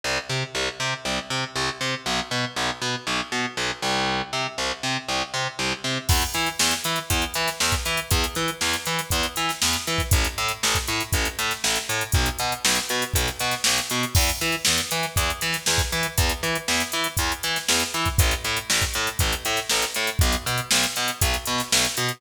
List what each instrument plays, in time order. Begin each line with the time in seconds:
0.04 electric bass (finger) C2
0.30 electric bass (finger) C3
0.55 electric bass (finger) C2
0.80 electric bass (finger) C3
1.05 electric bass (finger) C2
1.30 electric bass (finger) C3
1.56 electric bass (finger) C2
1.81 electric bass (finger) C3
2.06 electric bass (finger) B1
2.31 electric bass (finger) B2
2.56 electric bass (finger) B1
2.82 electric bass (finger) B2
3.07 electric bass (finger) B1
3.32 electric bass (finger) B2
3.57 electric bass (finger) B1
3.82 electric bass (finger) C2
4.33 electric bass (finger) C3
4.58 electric bass (finger) C2
4.83 electric bass (finger) C3
5.09 electric bass (finger) C2
5.34 electric bass (finger) C3
5.59 electric bass (finger) C2
5.84 electric bass (finger) C3
6.09 electric bass (finger) E2, kick, crash
6.21 closed hi-hat
6.34 electric bass (finger) E3, closed hi-hat
6.46 closed hi-hat
6.59 electric bass (finger) E2, snare
6.71 closed hi-hat
6.84 electric bass (finger) E3, closed hi-hat
6.96 snare, closed hi-hat
7.10 electric bass (finger) E2, kick, closed hi-hat
7.22 closed hi-hat
7.34 electric bass (finger) E3, closed hi-hat
7.47 snare, closed hi-hat
7.60 electric bass (finger) E2, snare
7.72 kick, closed hi-hat
7.85 electric bass (finger) E3, closed hi-hat
7.97 closed hi-hat
8.11 electric bass (finger) E2, kick, closed hi-hat
8.24 closed hi-hat
8.35 electric bass (finger) E3, closed hi-hat
8.48 closed hi-hat
8.61 electric bass (finger) E2, snare
8.73 closed hi-hat
8.86 electric bass (finger) E3, closed hi-hat
8.99 snare, closed hi-hat
9.10 electric bass (finger) E2, kick, closed hi-hat
9.23 closed hi-hat
9.36 electric bass (finger) E3, closed hi-hat
9.49 snare, closed hi-hat
9.62 electric bass (finger) E2, snare
9.73 closed hi-hat
9.87 electric bass (finger) E3, closed hi-hat
9.98 kick, snare, closed hi-hat
10.11 electric bass (finger) A1, kick, closed hi-hat
10.24 snare, closed hi-hat
10.38 electric bass (finger) A2, closed hi-hat
10.48 closed hi-hat
10.63 electric bass (finger) A1, snare
10.75 kick, closed hi-hat
10.88 electric bass (finger) A2, closed hi-hat
11.00 closed hi-hat
11.12 electric bass (finger) A1, kick, closed hi-hat
11.25 closed hi-hat
11.39 electric bass (finger) A2, closed hi-hat
11.51 snare, closed hi-hat
11.64 electric bass (finger) A1, snare
11.75 closed hi-hat
11.89 electric bass (finger) A2, closed hi-hat
12.01 closed hi-hat
12.12 electric bass (finger) B1, kick, closed hi-hat
12.26 closed hi-hat
12.39 electric bass (finger) B2, closed hi-hat
12.52 closed hi-hat
12.65 electric bass (finger) B1, snare
12.75 closed hi-hat
12.89 electric bass (finger) B2, snare, closed hi-hat
13.02 closed hi-hat
13.14 electric bass (finger) B1, kick, closed hi-hat
13.28 snare, closed hi-hat
13.39 electric bass (finger) B2, closed hi-hat
13.51 snare, closed hi-hat
13.64 electric bass (finger) B1, snare
13.78 closed hi-hat
13.90 electric bass (finger) B2, closed hi-hat
14.03 closed hi-hat
14.15 electric bass (finger) E2, kick, crash
14.29 closed hi-hat
14.41 electric bass (finger) E3, closed hi-hat
14.52 closed hi-hat
14.65 electric bass (finger) E2, snare
14.78 closed hi-hat
14.91 electric bass (finger) E3, closed hi-hat
15.03 snare, closed hi-hat
15.16 electric bass (finger) E2, kick, closed hi-hat
15.30 closed hi-hat
15.41 electric bass (finger) E3, closed hi-hat
15.53 snare, closed hi-hat
15.66 electric bass (finger) E2, snare
15.78 kick, closed hi-hat
15.92 electric bass (finger) E3, closed hi-hat
16.03 closed hi-hat
16.18 electric bass (finger) E2, kick, closed hi-hat
16.29 closed hi-hat
16.43 electric bass (finger) E3, closed hi-hat
16.55 closed hi-hat
16.68 electric bass (finger) E2, snare
16.80 closed hi-hat
16.92 electric bass (finger) E3, closed hi-hat
17.04 snare, closed hi-hat
17.17 electric bass (finger) E2, kick, closed hi-hat
17.32 closed hi-hat
17.43 electric bass (finger) E3, closed hi-hat
17.56 snare, closed hi-hat
17.68 electric bass (finger) E2, snare
17.80 closed hi-hat
17.94 electric bass (finger) E3, closed hi-hat
18.05 kick, snare, closed hi-hat
18.18 electric bass (finger) A1, kick, closed hi-hat
18.31 snare, closed hi-hat
18.44 electric bass (finger) A2, closed hi-hat
18.57 closed hi-hat
18.70 electric bass (finger) A1, snare
18.82 kick, closed hi-hat
18.94 electric bass (finger) A2, closed hi-hat
19.07 closed hi-hat
19.19 electric bass (finger) A1, kick, closed hi-hat
19.32 closed hi-hat
19.45 electric bass (finger) A2, closed hi-hat
19.56 snare, closed hi-hat
19.69 electric bass (finger) A1, snare
19.82 closed hi-hat
19.94 electric bass (finger) A2, closed hi-hat
20.07 closed hi-hat
20.19 electric bass (finger) B1, kick, closed hi-hat
20.32 closed hi-hat
20.46 electric bass (finger) B2, closed hi-hat
20.58 closed hi-hat
20.71 electric bass (finger) B1, snare
20.83 closed hi-hat
20.96 electric bass (finger) B2, snare, closed hi-hat
21.08 closed hi-hat
21.21 electric bass (finger) B1, kick, closed hi-hat
21.33 snare, closed hi-hat
21.45 electric bass (finger) B2, closed hi-hat
21.58 snare, closed hi-hat
21.72 electric bass (finger) B1, snare
21.85 closed hi-hat
21.97 electric bass (finger) B2, closed hi-hat
22.09 closed hi-hat